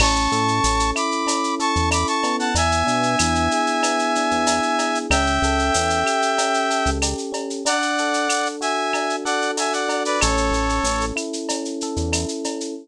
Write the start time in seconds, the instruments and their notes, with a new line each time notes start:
0.00 synth bass 1 A1, electric piano 1 C#4, brass section A5 C#6, crash, cowbell, claves
0.16 shaker
0.32 synth bass 1 A2, electric piano 1 A4, shaker
0.48 shaker
0.64 synth bass 1 A1, electric piano 1 C#4, tambourine, shaker
0.80 shaker
0.95 electric piano 1 E4, brass section B5 D6, claves, shaker
1.11 shaker
1.26 electric piano 1 C#4, cowbell, shaker
1.44 shaker
1.60 electric piano 1 A4, brass section A5 C#6, shaker
1.76 synth bass 1 E2, shaker
1.91 electric piano 1 E4, brass section B5 D6, tambourine, cowbell, claves, shaker
2.07 brass section A5 C#6, shaker
2.23 electric piano 1 B3, cowbell, shaker
2.39 brass section F#5 A5, shaker
2.55 synth bass 1 E2, brass section E5 G#5, cowbell, shaker
2.72 shaker
2.86 synth bass 1 B2, electric piano 1 D4, shaker
3.03 shaker
3.19 synth bass 1 E2, electric piano 1 E4, tambourine, claves, shaker
3.35 shaker
3.51 electric piano 1 G#4, shaker
3.66 shaker
3.83 electric piano 1 B3, cowbell, claves, shaker
3.99 shaker
4.15 electric piano 1 D4, shaker
4.31 synth bass 1 E2, shaker
4.47 electric piano 1 E4, tambourine, cowbell, shaker
4.63 shaker
4.79 electric piano 1 G#4, cowbell, shaker
4.95 shaker
5.10 synth bass 1 C#2, electric piano 1 C#4, brass section E5 G5, cowbell, claves, shaker
5.26 shaker
5.42 synth bass 1 C#2, electric piano 1 A4, shaker
5.59 shaker
5.74 synth bass 1 E2, electric piano 1 C#4, tambourine, shaker
5.90 shaker
6.05 electric piano 1 G4, claves, shaker
6.22 shaker
6.38 electric piano 1 C#4, cowbell, shaker
6.54 shaker
6.70 electric piano 1 A4, shaker
6.86 synth bass 1 C#2, shaker
7.02 electric piano 1 G4, tambourine, cowbell, claves, shaker
7.18 shaker
7.32 electric piano 1 C#4, cowbell, shaker
7.50 shaker
7.65 electric piano 1 D4, brass section D5 F#5, cowbell, shaker
7.82 shaker
7.98 electric piano 1 A4, shaker
8.14 shaker
8.28 electric piano 1 D4, tambourine, claves, shaker
8.46 shaker
8.61 electric piano 1 F#4, brass section E5 G#5, shaker
8.93 electric piano 1 D4, cowbell, claves, shaker
9.10 shaker
9.24 electric piano 1 A4, brass section D5 F#5, shaker
9.42 shaker
9.57 electric piano 1 F#4, brass section E5 G#5, tambourine, cowbell, shaker
9.72 brass section D5 F#5, shaker
9.88 electric piano 1 D4, cowbell, shaker
10.05 brass section B4 D5, shaker
10.20 synth bass 1 A1, electric piano 1 C#4, brass section A4 C#5, cowbell, claves, shaker
10.37 shaker
10.51 synth bass 1 A1, electric piano 1 A4, shaker
10.69 shaker
10.83 synth bass 1 A1, electric piano 1 C#4, tambourine, shaker
11.01 shaker
11.16 electric piano 1 E4, claves, shaker
11.33 shaker
11.49 electric piano 1 C#4, cowbell, shaker
11.65 shaker
11.81 electric piano 1 A4, shaker
11.96 synth bass 1 E2, shaker
12.13 electric piano 1 E4, tambourine, cowbell, claves, shaker
12.28 shaker
12.44 electric piano 1 C#4, cowbell, shaker
12.61 shaker